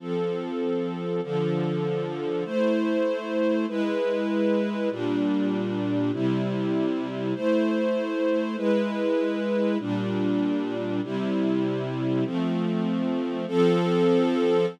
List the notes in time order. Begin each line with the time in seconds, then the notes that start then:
0.00 F3 C4 A4
1.23 D3 F3 A4
2.45 A3 E4 C5
3.68 G#3 E4 B4
4.90 A#2 G3 D4
6.12 C3 G3 E4
7.35 A3 E4 C5
8.56 G#3 E4 B4
9.79 A#2 G3 D4
11.03 C3 G3 E4
12.24 F3 A3 C4
13.48 F3 C4 A4